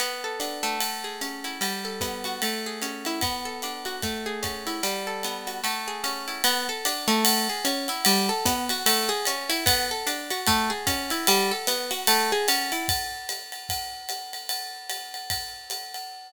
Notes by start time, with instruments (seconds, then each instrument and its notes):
0.00 acoustic guitar (steel) B3, ride
0.24 acoustic guitar (steel) A4
0.40 acoustic guitar (steel) D4, hi-hat pedal, ride
0.63 acoustic guitar (steel) A3, ride
0.81 ride
1.04 acoustic guitar (steel) G#4
1.21 acoustic guitar (steel) C#4, hi-hat pedal, ride
1.44 acoustic guitar (steel) E4, ride
1.61 acoustic guitar (steel) G3, ride
1.85 acoustic guitar (steel) A4
2.01 acoustic guitar (steel) B3, kick, hi-hat pedal, ride
2.24 acoustic guitar (steel) F#4, ride
2.42 acoustic guitar (steel) A3, ride
2.66 acoustic guitar (steel) G#4
2.82 acoustic guitar (steel) C#4, hi-hat pedal, ride
3.05 acoustic guitar (steel) E4, ride
3.21 acoustic guitar (steel) B3, kick, ride
3.45 acoustic guitar (steel) A4
3.62 acoustic guitar (steel) D4, hi-hat pedal, ride
3.85 acoustic guitar (steel) F#4, ride
4.02 acoustic guitar (steel) A3, kick, ride
4.26 acoustic guitar (steel) G#4
4.43 acoustic guitar (steel) C#4, kick, hi-hat pedal, ride
4.67 acoustic guitar (steel) E4, ride
4.83 acoustic guitar (steel) G3, ride
5.07 acoustic guitar (steel) A4
5.23 acoustic guitar (steel) B3, hi-hat pedal, ride
5.47 acoustic guitar (steel) F#4, ride
5.64 acoustic guitar (steel) A3, ride
5.88 acoustic guitar (steel) G#4
6.04 acoustic guitar (steel) C#4, hi-hat pedal, ride
6.28 acoustic guitar (steel) E4, ride
6.44 acoustic guitar (steel) B3, ride
6.69 acoustic guitar (steel) A4
6.85 acoustic guitar (steel) D4, hi-hat pedal, ride
7.08 acoustic guitar (steel) A3, ride
7.25 ride
7.49 acoustic guitar (steel) G#4
7.65 acoustic guitar (steel) C#4, hi-hat pedal, ride
7.88 acoustic guitar (steel) E4, ride
8.05 acoustic guitar (steel) G3, ride
8.29 acoustic guitar (steel) A4
8.45 acoustic guitar (steel) B3, kick, hi-hat pedal, ride
8.69 acoustic guitar (steel) F#4, ride
8.86 acoustic guitar (steel) A3, ride
9.09 acoustic guitar (steel) G#4
9.25 acoustic guitar (steel) C#4, hi-hat pedal, ride
9.49 acoustic guitar (steel) E4, ride
9.66 acoustic guitar (steel) B3, kick, ride
9.91 acoustic guitar (steel) A4
10.07 acoustic guitar (steel) D4, hi-hat pedal, ride
10.30 acoustic guitar (steel) F#4, ride
10.47 acoustic guitar (steel) A3, kick, ride
10.70 acoustic guitar (steel) G#4
10.87 acoustic guitar (steel) C#4, kick, hi-hat pedal, ride
11.10 acoustic guitar (steel) E4, ride
11.27 acoustic guitar (steel) G3, ride
11.51 acoustic guitar (steel) A4
11.67 acoustic guitar (steel) B3, hi-hat pedal, ride
11.91 acoustic guitar (steel) F#4, ride
12.07 acoustic guitar (steel) A3, ride
12.32 acoustic guitar (steel) G#4
12.48 acoustic guitar (steel) C#4, hi-hat pedal, ride
12.72 acoustic guitar (steel) E4, ride
12.88 kick, ride
13.29 hi-hat pedal, ride
13.52 ride
13.69 kick, ride
14.09 hi-hat pedal, ride
14.33 ride
14.49 ride
14.90 hi-hat pedal, ride
15.14 ride
15.30 kick, ride
15.70 hi-hat pedal, ride
15.94 ride